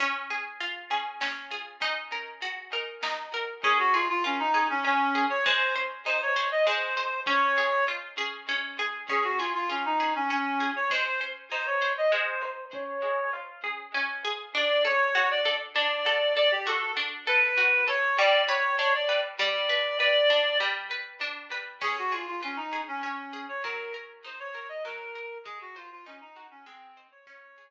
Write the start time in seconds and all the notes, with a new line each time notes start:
0.00 C#4, kick, closed hi-hat
0.30 G#4
0.60 F4, closed hi-hat
0.91 G#4
1.21 C#4, snare
1.51 G#4
1.81 D#4, kick, closed hi-hat
2.12 A#4
2.42 F#4, closed hi-hat
2.73 A#4
3.03 D#4, snare
3.34 A#4
3.64 C#4 G#4, kick
3.79 F#4
3.93 F4 G#4
4.09 F4
4.24 C#4 F4
4.39 D#4
4.54 G#4
4.70 C#4
4.84 C#4
5.15 G#4
5.30 C#5
5.45 G#3 C5, kick
5.76 C5
6.06 D#4 C5
6.22 C#5
6.36 C5
6.51 D#5
6.67 G#3 C5
6.97 C5
7.26 C#4 C#5, kick
7.58 G#4
7.88 F4
8.18 G#4
8.49 C#4
8.79 G#4
9.09 C#4 G#4, kick
9.24 F#4
9.39 F4 G#4
9.54 F4
9.70 C#4 F4
9.85 D#4
10.00 G#4
10.15 C#4
10.30 C#4
10.60 G#4
10.76 C#5
10.90 G#3 C5, kick
11.21 C5
11.51 D#4 C5
11.66 C#5
11.82 C5
11.98 D#5
12.12 G#3 C5
12.43 C5
12.73 C#4 C#5, kick
13.03 G#4
13.33 F4
13.64 G#4
13.94 C#4
14.25 G#4
14.55 D4 D5
14.85 A4 C#5
15.15 F#4 C#5
15.31 D5
15.45 A4
15.75 D4 D5
16.06 A4
16.37 A4 D5
16.51 G4
16.67 F#4 A4
16.97 D4
17.27 A4 B4
17.57 F#4
17.88 A4 C#5
18.18 G3 D5
18.48 B4 C#5
18.78 D4 C#5
18.95 D5
19.09 B4
19.39 G3 D5
19.69 B4
20.00 B4 D5
20.30 D4
20.60 G3
20.91 B4
21.21 D4
21.52 B4
21.81 C#4 G#4, kick, crash
21.98 F#4
22.12 F4 G#4
22.27 F4
22.43 C#4 F4
22.56 D#4
22.73 G#4
22.88 C#4
23.03 C#4
23.33 G#4
23.49 C#5
23.64 F#3 A#4, kick
23.94 A#4
24.24 D#4 C5
24.39 C#5
24.55 A#4
24.69 D#5
24.85 F#3 A#4
25.15 A#4
25.45 G#3 G#4, kick
25.61 F#4
25.76 F4 C5
25.91 F4
26.06 C#4 D#4
26.21 D#4
26.36 F#4
26.51 C#4
26.66 G#3 C4
26.97 C5
27.11 C#5
27.27 C#4 C#5, kick
27.58 G#4